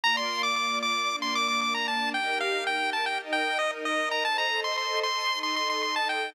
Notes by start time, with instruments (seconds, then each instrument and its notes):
0.04 string ensemble 1 A#3 F4 D5, lead 1 (square) A#5
0.17 lead 1 (square) C6
0.43 lead 1 (square) D6
0.56 lead 1 (square) D6
0.83 lead 1 (square) D6
1.09 string ensemble 1 A#3 D4 D5
1.22 lead 1 (square) C6
1.35 lead 1 (square) D6
1.48 lead 1 (square) D6
1.61 lead 1 (square) D6
1.74 lead 1 (square) A#5
1.88 lead 1 (square) A5
2.14 string ensemble 1 D#4 G4 A#4, lead 1 (square) G5
2.40 lead 1 (square) F5
2.67 lead 1 (square) G5
2.93 lead 1 (square) A5
3.06 lead 1 (square) G5
3.20 string ensemble 1 D#4 A#4 D#5
3.33 lead 1 (square) G5
3.59 lead 1 (square) D#5
3.85 lead 1 (square) D#5
4.11 lead 1 (square) A#5
4.25 string ensemble 1 A4 C5 D#5, lead 1 (square) A5
4.38 lead 1 (square) A#5
4.64 lead 1 (square) C6
4.78 lead 1 (square) C6
5.03 lead 1 (square) C6
5.30 string ensemble 1 D#4 A4 D#5
5.43 lead 1 (square) C6
5.56 lead 1 (square) C6
5.70 lead 1 (square) C6
5.83 lead 1 (square) C6
5.96 lead 1 (square) A5
6.09 lead 1 (square) G5